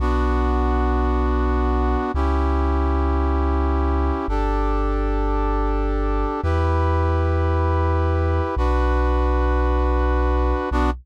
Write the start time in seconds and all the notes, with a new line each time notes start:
0.00 B1 B3 D4 F#4
2.14 C#2 C#4 E4 G4
4.28 G1 D4 G4 A4
6.43 E2 E4 G4 B4
8.56 B1 D4 F#4 B4
10.71 B1 B3 D4 F#4